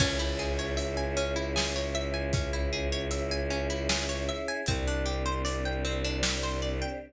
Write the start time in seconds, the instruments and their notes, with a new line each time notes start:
0.00 violin C#2, pizzicato strings C#4, choir aahs C#4 E4 G#4, kick, crash
0.19 pizzicato strings E4
0.39 pizzicato strings G#4
0.59 pizzicato strings C#5
0.77 pizzicato strings E5, closed hi-hat
0.97 pizzicato strings G#5
1.17 pizzicato strings C#4
1.36 pizzicato strings E4
1.56 pizzicato strings G#4, snare
1.76 pizzicato strings C#5
1.95 pizzicato strings E5
2.14 pizzicato strings G#5
2.33 pizzicato strings C#4, kick, closed hi-hat
2.53 pizzicato strings E4
2.73 pizzicato strings G#4
2.92 pizzicato strings C#5
3.11 pizzicato strings E5, closed hi-hat
3.31 pizzicato strings G#5
3.50 pizzicato strings C#4
3.70 pizzicato strings E4
3.89 pizzicato strings G#4, snare
4.09 pizzicato strings C#5
4.29 pizzicato strings E5
4.48 pizzicato strings G#5
4.66 violin C2, choir aahs C4 D4 G4, pizzicato strings C4, kick, closed hi-hat
4.88 pizzicato strings D4
5.06 pizzicato strings G4
5.26 pizzicato strings C5
5.45 pizzicato strings D5, closed hi-hat
5.65 pizzicato strings G5
5.85 pizzicato strings C4
6.04 pizzicato strings D4
6.23 pizzicato strings G4, snare
6.43 pizzicato strings C5
6.62 pizzicato strings D5
6.82 pizzicato strings G5